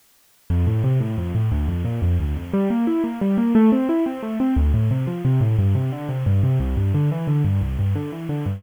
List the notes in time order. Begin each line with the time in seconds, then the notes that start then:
0.50 F2
0.67 A2
0.84 C3
1.00 A2
1.18 F2
1.35 A2
1.52 D2
1.68 F2
1.85 A#2
2.02 F2
2.20 D2
2.36 F2
2.53 G3
2.70 A#3
2.87 E4
3.04 A#3
3.21 G3
3.38 A#3
3.55 A3
3.72 C4
3.89 E4
4.06 C4
4.23 A3
4.40 C4
4.56 D2
4.74 A2
4.91 C3
5.07 F3
5.25 C3
5.41 A2
5.59 G2
5.75 C3
5.92 D3
6.09 C3
6.26 G2
6.43 C3
6.60 C2
6.77 G2
6.94 D3
7.12 E3
7.28 D3
7.45 G2
7.61 C2
7.79 G2
7.95 D3
8.12 E3
8.29 D3
8.46 G2